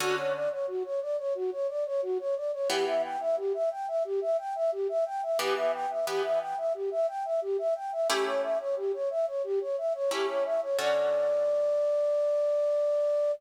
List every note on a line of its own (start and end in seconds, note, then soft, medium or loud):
0.00 0.48 D3 loud
0.00 0.48 C#4 loud
0.00 0.15 F#4 loud
0.00 0.48 F#4 loud
0.00 0.48 A4 loud
0.17 0.32 C#5 medium
0.34 0.49 D5 medium
0.51 0.66 C#5 medium
0.67 0.83 F#4 medium
0.84 1.00 C#5 medium
1.01 1.17 D5 medium
1.18 1.33 C#5 medium
1.35 1.50 F#4 medium
1.52 1.67 C#5 medium
1.69 1.84 D5 medium
1.85 2.01 C#5 medium
2.02 2.18 F#4 loud
2.19 2.35 C#5 medium
2.36 2.51 D5 medium
2.53 2.68 C#5 medium
2.70 3.17 E3 loud
2.70 3.17 B3 loud
2.70 3.17 G4 loud
2.70 2.85 G4 medium
2.87 3.02 E5 medium
3.03 3.19 G5 medium
3.20 3.36 E5 medium
3.37 3.53 G4 medium
3.54 3.69 E5 medium
3.71 3.86 G5 medium
3.88 4.03 E5 medium
4.04 4.20 G4 medium
4.21 4.37 E5 medium
4.38 4.54 G5 medium
4.55 4.71 E5 medium
4.72 4.87 G4 medium
4.89 5.04 E5 medium
5.06 5.21 G5 medium
5.22 5.38 E5 medium
5.39 5.86 E3 loud
5.39 5.86 B3 loud
5.39 5.86 G4 loud
5.39 5.55 G4 medium
5.56 5.72 E5 medium
5.73 5.88 G5 medium
5.90 6.05 E5 medium
6.07 6.54 E3 medium
6.07 6.54 B3 loud
6.07 6.22 G4 medium
6.07 6.54 G4 medium
6.24 6.39 E5 medium
6.40 6.56 G5 medium
6.57 6.73 E5 medium
6.74 6.90 G4 medium
6.91 7.06 E5 medium
7.08 7.23 G5 medium
7.25 7.40 E5 medium
7.42 7.57 G4 medium
7.58 7.74 E5 medium
7.75 7.91 G5 medium
7.92 8.08 E5 medium
8.09 8.57 A3 loud
8.09 8.57 C#4 loud
8.09 8.57 E4 loud
8.09 8.25 G4 loud
8.09 8.57 G4 loud
8.26 8.41 C#5 medium
8.43 8.58 E5 medium
8.60 8.75 C#5 medium
8.76 8.92 G4 medium
8.93 9.09 C#5 medium
9.10 9.26 E5 medium
9.27 9.42 C#5 medium
9.44 9.59 G4 loud
9.61 9.76 C#5 medium
9.78 9.93 E5 medium
9.94 10.10 C#5 medium
10.11 10.58 A3 medium
10.11 10.58 C#4 medium
10.11 10.58 E4 loud
10.11 10.58 G4 medium
10.11 10.27 G4 medium
10.28 10.44 C#5 medium
10.45 10.60 E5 medium
10.62 10.77 C#5 medium
10.79 13.31 D3 loud
10.79 13.31 C#4 loud
10.79 13.31 F#4 loud
10.79 13.31 A4 loud
10.79 13.32 D5 loud